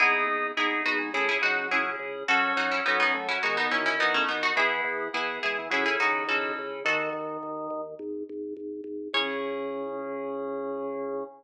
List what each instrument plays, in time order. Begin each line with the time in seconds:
0.00 drawbar organ G#1 D#4, electric piano 2 B3 D#4 G#4, harpsichord E4 G#4
0.27 drawbar organ G#1
0.57 drawbar organ G#1 D#4, electric piano 2 B3 D#4 G#4, harpsichord E4 G#4
0.85 drawbar organ G#1 B3, harpsichord D#4 F#4
0.98 drawbar organ G#3
1.13 drawbar organ C#2 A3, electric piano 2 C#4 E4 G#4, harpsichord E4 G#4
1.29 harpsichord E4 G#4
1.42 drawbar organ C#2 F#3, harpsichord D#4 F#4
1.71 drawbar organ C#2, electric piano 2 C#4 E4 G#4, harpsichord E4 G#4
1.99 drawbar organ C#2
2.28 drawbar organ F#2 C#4, electric piano 2 C#4 F#4 A4, harpsichord F#4 A4
2.56 drawbar organ F#2, harpsichord D#4 F#4
2.71 harpsichord C#4 E4
2.86 drawbar organ F#2 C#4, harpsichord B3 D#4, electric piano 2 C#4 F#4 A4
3.00 harpsichord B3 D#4
3.14 drawbar organ F#2 A3
3.29 drawbar organ F#3, harpsichord C#4 E4
3.42 drawbar organ D#2 G#3, electric piano 2 B3 D#4 F#4, harpsichord D#4 F#4
3.57 harpsichord B3 D#4
3.71 drawbar organ D#2 E3, harpsichord C#4 E4
3.86 harpsichord C#4 E4
3.98 drawbar organ D#2, electric piano 2 B3 D#4 F#4, harpsichord B3 D#4
4.14 harpsichord A3 C#4
4.28 drawbar organ D#2, harpsichord B3 D#4
4.43 harpsichord D#4 F#4
4.56 drawbar organ E2 B3, electric piano 2 B3 E4 G#4, harpsichord E4 G#4
4.84 drawbar organ E2
5.13 drawbar organ E2 B3, electric piano 2 B3 E4 G#4, harpsichord E4 G#4
5.43 drawbar organ E2 G#3, harpsichord E4 G#4
5.58 drawbar organ E3
5.70 drawbar organ C#2 F#3, electric piano 2 C#4 E4 A4, harpsichord E4 G#4
5.86 harpsichord E4 G#4
5.99 drawbar organ C#2 D#3, harpsichord D#4 F#4
6.28 drawbar organ C#2, electric piano 2 C#4 E4 A4, harpsichord F#4 A4
6.59 drawbar organ C#2
6.85 drawbar organ D#2 D#3, harpsichord F#4 A4
7.13 drawbar organ D#2
7.43 drawbar organ D#2
7.70 drawbar organ D#2
7.99 drawbar organ G#1
8.29 drawbar organ G#1
8.57 drawbar organ G#1
8.84 drawbar organ G#1
9.13 drawbar organ C#2 C#3, electric piano 2 C#4 E4 G#4, harpsichord C#5